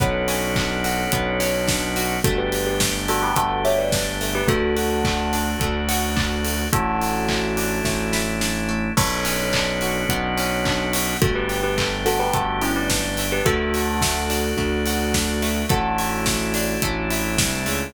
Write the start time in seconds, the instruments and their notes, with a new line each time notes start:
0.00 synth bass 1 B1, acoustic guitar (steel) B3, drawbar organ B3 C#4 D4 F#4, tubular bells A4 C#5, kick, closed hi-hat
0.28 acoustic guitar (steel) C#4, open hi-hat
0.56 acoustic guitar (steel) D4, kick, clap
0.84 acoustic guitar (steel) F#4, open hi-hat
1.12 synth bass 1 B1, acoustic guitar (steel) B3, kick, closed hi-hat
1.40 acoustic guitar (steel) C#4, open hi-hat
1.68 acoustic guitar (steel) D4, kick, snare
1.96 acoustic guitar (steel) F#4, open hi-hat
2.24 synth bass 1 G1, drawbar organ A3 D4 G4, acoustic guitar (steel) A3, tubular bells F#4 A4, kick, closed hi-hat
2.38 tubular bells G4 B4
2.52 acoustic guitar (steel) G4, open hi-hat
2.67 tubular bells G4 B4
2.80 acoustic guitar (steel) A3, kick, snare
3.08 acoustic guitar (steel) D4, tubular bells F#4 A4, open hi-hat
3.23 tubular bells G4 B4
3.36 synth bass 1 G1, acoustic guitar (steel) A3, tubular bells F#4 A4, kick, closed hi-hat
3.65 acoustic guitar (steel) G4, tubular bells C#5 E5, open hi-hat
3.78 tubular bells B4 D5
3.92 acoustic guitar (steel) D4, kick, snare
4.21 acoustic guitar (steel) A3, open hi-hat
4.35 tubular bells G4 B4
4.47 synth bass 1 D2, acoustic guitar (steel) A3, drawbar organ A3 D4 F#4, tubular bells F#4 A4, kick, closed hi-hat
4.77 acoustic guitar (steel) F#4, open hi-hat
5.04 acoustic guitar (steel) A3, kick, clap
5.33 acoustic guitar (steel) D4, open hi-hat
5.60 synth bass 1 D2, acoustic guitar (steel) A3, kick, closed hi-hat
5.89 acoustic guitar (steel) F#4, open hi-hat
6.16 acoustic guitar (steel) D4, kick, clap
6.45 acoustic guitar (steel) A3, open hi-hat
6.73 synth bass 1 A1, acoustic guitar (steel) A3, drawbar organ A3 D4 E4, tubular bells F#4 A4, kick, closed hi-hat
7.01 acoustic guitar (steel) E4, open hi-hat
7.29 acoustic guitar (steel) A3, kick, clap
7.57 acoustic guitar (steel) D4, open hi-hat
7.84 synth bass 1 A1, acoustic guitar (steel) A3, kick, snare
8.13 acoustic guitar (steel) E4, snare
8.41 acoustic guitar (steel) D4, snare
8.69 acoustic guitar (steel) A3
8.97 synth bass 1 B1, acoustic guitar (steel) B3, drawbar organ B3 C#4 D4 F#4, tubular bells A4 C#5, kick, crash
9.25 acoustic guitar (steel) C#4, open hi-hat
9.53 acoustic guitar (steel) D4, kick, clap
9.81 acoustic guitar (steel) F#4, open hi-hat
10.09 synth bass 1 B1, acoustic guitar (steel) B3, kick, closed hi-hat
10.38 acoustic guitar (steel) C#4, open hi-hat
10.65 acoustic guitar (steel) D4, kick, clap
10.93 acoustic guitar (steel) F#4, open hi-hat
11.22 synth bass 1 G1, acoustic guitar (steel) A3, drawbar organ A3 D4 G4, tubular bells F#4 A4, kick, closed hi-hat
11.35 tubular bells G4 B4
11.49 acoustic guitar (steel) G4, open hi-hat
11.63 tubular bells G4 B4
11.78 acoustic guitar (steel) A3, kick, clap
12.06 acoustic guitar (steel) D4, tubular bells F#4 A4, open hi-hat
12.19 tubular bells G4 B4
12.33 synth bass 1 G1, acoustic guitar (steel) A3, tubular bells F#4 A4, kick, closed hi-hat
12.61 tubular bells C#4 E4, acoustic guitar (steel) G4, open hi-hat
12.76 tubular bells B4 D5
12.90 acoustic guitar (steel) D4, kick, snare
13.17 acoustic guitar (steel) A3, open hi-hat
13.32 tubular bells G4 B4
13.45 synth bass 1 D2, acoustic guitar (steel) A3, drawbar organ A3 D4 F#4, tubular bells F#4 A4, kick, closed hi-hat
13.74 acoustic guitar (steel) F#4, open hi-hat
14.01 acoustic guitar (steel) A3, kick, snare
14.30 acoustic guitar (steel) D4, open hi-hat
14.57 synth bass 1 D2, acoustic guitar (steel) A3, kick
14.86 acoustic guitar (steel) F#4, open hi-hat
15.14 acoustic guitar (steel) D4, kick, snare
15.42 acoustic guitar (steel) A3, open hi-hat
15.69 synth bass 1 A1, acoustic guitar (steel) A3, drawbar organ A3 D4 E4, tubular bells F#4 A4, kick, closed hi-hat
15.98 acoustic guitar (steel) E4, open hi-hat
16.26 acoustic guitar (steel) A3, kick, snare
16.54 acoustic guitar (steel) D4, open hi-hat
16.82 synth bass 1 A1, acoustic guitar (steel) A3, kick, closed hi-hat
17.11 acoustic guitar (steel) E4, open hi-hat
17.38 synth bass 1 C2, acoustic guitar (steel) D4, kick, snare
17.66 synth bass 1 C#2, acoustic guitar (steel) A3, open hi-hat